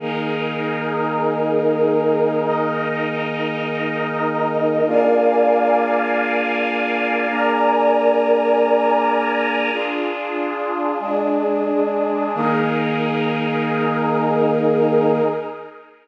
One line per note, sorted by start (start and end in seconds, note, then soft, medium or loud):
0.00 4.81 D#3 medium
0.00 4.81 A#3 medium
0.00 2.40 D#4 loud
0.00 2.40 G#4 medium
0.00 4.81 G#4 medium
0.00 2.40 A#4 medium
2.43 4.84 D#4 loud
2.43 4.84 A#4 medium
2.43 4.84 D#5 medium
4.86 7.27 A#3 medium
4.86 7.27 D4 medium
4.86 7.27 F4 medium
4.86 7.27 G#4 medium
4.86 7.28 A#4 medium
4.86 7.28 D5 medium
4.86 7.28 F5 medium
4.86 7.28 G#5 medium
7.29 9.70 A#3 medium
7.29 9.70 D4 medium
7.29 9.70 G#4 medium
7.29 9.70 A#4 medium
7.29 9.70 D5 medium
7.29 9.70 G#5 medium
7.29 9.70 A#5 loud
9.72 10.97 D4 medium
9.72 10.98 D4 medium
9.72 10.97 F4 medium
9.72 10.98 F4 medium
9.72 10.97 G#4 medium
9.72 10.98 G#4 medium
10.99 12.34 G#3 medium
10.99 12.35 G#3 medium
10.99 12.34 D4 medium
10.99 12.35 D4 medium
10.99 12.34 G#4 medium
12.35 15.21 D#3 loud
12.35 15.21 A#3 loud
12.35 15.22 D#4 loud
12.35 15.21 G#4 loud
12.35 15.22 G#4 loud
12.35 15.22 A#4 medium